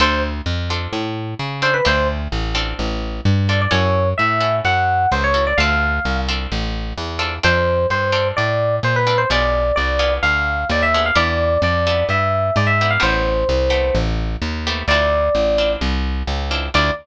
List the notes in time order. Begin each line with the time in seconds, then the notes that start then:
0.00 D2 C4 D4 F4 A4 C5
0.46 F2
0.70 C4 D4 F4 A4
0.93 A2
1.39 C#3
1.62 C4 D4 F4 A4 C5
1.74 B4
1.85 D2 C4 D4 F4 A4 C5
2.32 A1
2.55 C4 D4 F4 A4
2.79 A1
3.25 G2
3.49 C4 D4 F4 A4 D5
3.61 D5
3.71 F#2 C#4 E4 F#4 A4 C#5
4.18 A2 E5
4.41 C#4 E4 F#4 A4
4.65 F#2 F#5
5.12 C#2 C5
5.24 C#5
5.34 C#4 E4 F#4 A4
5.47 D5
5.57 D2 C4 D4 F4 A4 F5
6.05 C2
6.28 C4 D4 F4 A4
6.52 A1
6.97 E2
7.19 C4 D4 F4 A4
7.43 F2 C4 D4 F4 A4 C5
7.90 G2 C5
8.12 C4 D4 F4 A4
8.37 A2 D5
8.83 A#2 C5
8.96 B4
9.07 C4 D4 F4 A4
9.18 C5
9.30 B1 B3 D4 F4 G#4 D5
9.76 C2 D5
9.99 B3 D4 F4 G#4
10.22 D2 F5
10.69 D#2 D5
10.82 E5
10.94 B3 D4 F4 G#4
11.06 F5
11.15 E2 B3 D4 E4 G4 D5
11.62 F2 D5
11.87 B3 D4 E4 G4
12.09 G2 E5
12.56 G#2 D5
12.67 E5
12.81 B3 D4 E4 G4
12.90 F5
13.00 A1 A3 B3 C4 G4 C5
13.49 C2
13.70 A3 B3 C4 G4
13.95 A1
14.42 D#2
14.67 A3 B3 C4 G4
14.88 D2 C4 D4 E4 F4 D5
15.35 A1
15.58 C4 D4 E4 F4
15.81 C2
16.27 C#2
16.51 C4 D4 E4 F4
16.74 D2 C4 D4 E4 F4 D5